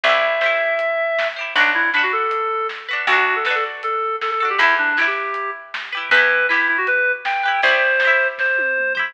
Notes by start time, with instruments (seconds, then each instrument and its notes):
0.03 electric bass (finger) C2, orchestral harp G4 C5, clarinet E5, kick, closed hi-hat
0.09 orchestral harp E4
0.41 orchestral harp G4 C5, snare
0.46 orchestral harp E4
0.79 closed hi-hat
1.19 snare
1.36 orchestral harp G4 C5
1.41 orchestral harp E4
1.55 electric bass (finger) B1, clarinet D4, orchestral harp F#4 B4, kick, closed hi-hat
1.60 orchestral harp D4
1.74 clarinet E4
1.93 clarinet D4, orchestral harp F#4 B4, snare
1.98 orchestral harp D4
2.03 clarinet F#4
2.12 clarinet A4
2.31 closed hi-hat
2.69 snare
2.89 orchestral harp F#4 B4
2.93 orchestral harp D4
3.07 electric bass (finger) D2, clarinet F#4, orchestral harp F#4 A4, kick, closed hi-hat
3.13 orchestral harp D4
3.17 clarinet F#4
3.36 clarinet A4
3.45 orchestral harp F#4 A4, clarinet B4, snare
3.50 orchestral harp D4
3.55 clarinet A4
3.83 clarinet A4, closed hi-hat
4.21 clarinet A4, snare
4.31 clarinet A4
4.40 orchestral harp F#4 A4, clarinet A4
4.45 orchestral harp D4
4.50 clarinet G4
4.58 electric bass (finger) E2, clarinet E4, orchestral harp G4 B4, kick, closed hi-hat
4.63 orchestral harp E4
4.78 clarinet D4
4.97 clarinet E4, orchestral harp G4 B4, snare
5.01 orchestral harp E4
5.07 clarinet G4
5.34 closed hi-hat
5.74 snare
5.92 orchestral harp G4 B4
5.97 orchestral harp E4
6.10 electric bass (finger) E2, clarinet B4, orchestral harp B4, kick, closed hi-hat
6.14 orchestral harp E4 G4
6.49 clarinet E4, orchestral harp G4 B4, snare
6.54 orchestral harp E4
6.68 clarinet E4
6.78 clarinet F#4
6.87 clarinet B4, closed hi-hat
7.25 clarinet G5, snare
7.43 orchestral harp G4 B4, clarinet G5
7.48 orchestral harp E4
7.62 electric bass (finger) C2, orchestral harp G4 C5, clarinet C5, kick, closed hi-hat
7.68 orchestral harp E4
8.00 orchestral harp C5, snare
8.05 orchestral harp E4 G4
8.38 clarinet C5, kick, snare
8.58 high tom
8.78 mid tom
8.95 orchestral harp G4 C5, floor tom
8.99 orchestral harp E4